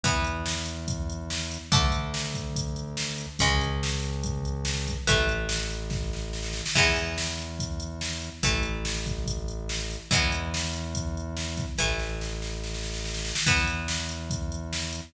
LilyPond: <<
  \new Staff \with { instrumentName = "Acoustic Guitar (steel)" } { \time 4/4 \key e \mixolydian \tempo 4 = 143 <e b>1 | <d a>1 | <cis gis>1 | <e a>1 |
<e gis b>1 | <e a>1 | <e gis b>1 | <e a>1 |
<e b>1 | }
  \new Staff \with { instrumentName = "Synth Bass 1" } { \clef bass \time 4/4 \key e \mixolydian e,1 | d,1 | cis,1 | a,,1 |
e,1 | a,,1 | e,1 | a,,1 |
e,1 | }
  \new DrumStaff \with { instrumentName = "Drums" } \drummode { \time 4/4 <hh bd>8 hh8 sn8 hh8 <hh bd>8 hh8 sn8 hh8 | <hh bd>8 hh8 sn8 <hh bd>8 <hh bd>8 hh8 sn8 hh8 | <hh bd>8 hh8 sn8 hh8 <hh bd>8 hh8 sn8 <hh bd>8 | <hh bd>8 hh8 sn8 hh8 <bd sn>8 sn8 sn16 sn16 sn16 sn16 |
<cymc bd>8 hh8 sn8 hh8 <hh bd>8 hh8 sn8 hh8 | <hh bd>8 hh8 sn8 <hh bd>8 <hh bd>8 hh8 sn8 hh8 | <hh bd>8 hh8 sn8 hh8 <hh bd>8 hh8 sn8 <hh bd>8 | <bd sn>8 sn8 sn8 sn8 sn16 sn16 sn16 sn16 sn16 sn16 sn16 sn16 |
<hh bd>8 hh8 sn8 hh8 <hh bd>8 hh8 sn8 hh8 | }
>>